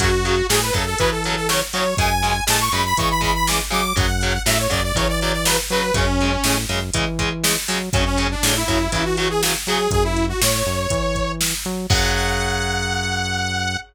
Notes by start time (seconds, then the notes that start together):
0.00 F#2 C#3 F#3 F#4, kick, closed hi-hat
0.25 C#3 F#3, closed hi-hat
0.49 A2 C#3 F#3 G#4, snare
0.62 B4
0.73 F#2 C#3 F#3 A4, kick, closed hi-hat
0.86 A4
0.98 C#3 E3 F#3 B4, kick, closed hi-hat
1.11 A4
1.24 C#3 F#3 A4, closed hi-hat
1.36 A4
1.49 C#3 F#3 C#5, snare
1.73 C#3 F#3 C#5, closed hi-hat
1.97 F#2 C#3 G#3 G#5, kick, closed hi-hat
2.23 C#3 G#3, closed hi-hat
2.47 A2 C#3 G#3 A5, snare
2.60 C#6
2.72 F#2 C#3 G#3 B5, closed hi-hat
2.85 B5
2.97 C#3 E3 G#3 C#6, kick, closed hi-hat
3.10 B5
3.21 C#3 G#3 B5, kick, closed hi-hat
3.35 B5
3.47 C#3 G#3 D6, snare
3.70 C#3 F#3 G#3 D6, closed hi-hat
3.96 F#2 C#3 F#3 F#5, kick, closed hi-hat
4.21 C#3 F#3, closed hi-hat
4.46 A2 C#3 F#3 E5, snare
4.59 C#5
4.70 F#2 C#3 F#3 D5, kick, closed hi-hat
4.84 D5
4.95 C#3 E3 F#3 C#5, kick, closed hi-hat
5.09 D5
5.20 C#3 F#3 D5, closed hi-hat
5.33 D5
5.45 C#3 F#3 B4, snare
5.70 C#3 F#3 B4, closed hi-hat
5.94 F#2 C#3 G#3 C#4, kick, closed hi-hat
6.21 C#3 G#3, closed hi-hat
6.44 A2 C#3 G#3, snare
6.69 F#2 C#3 G#3, closed hi-hat
6.93 C#3 E3 G#3, kick, closed hi-hat
7.19 C#3 G#3, kick, closed hi-hat
7.43 C#3 G#3, snare
7.68 C#3 F#3 G#3, open hi-hat
7.93 F#2 C#3 F#3 C#4, kick, closed hi-hat
8.06 C#4
8.17 C#3 F#3, closed hi-hat
8.31 D4
8.43 A2 C#3 F#3, snare
8.55 E4
8.68 F#2 C#3 F#3, kick, closed hi-hat
8.92 C#3 E3 F#3 E4, kick, closed hi-hat
9.05 F#4
9.17 C#3 F#3 F#4, closed hi-hat
9.30 G#4
9.43 C#3 F#3, snare
9.67 C#3 F#3 G#4, closed hi-hat
9.91 F#2 G#4, kick, closed hi-hat
10.04 E4
10.17 closed hi-hat
10.29 F#4
10.41 A2 C#5, snare
10.66 F#2, closed hi-hat
10.90 E3, kick, closed hi-hat
11.15 kick, closed hi-hat
11.41 snare, closed hi-hat
11.65 F#3, closed hi-hat
11.90 F#2 C#3 F#3 F#5, kick, crash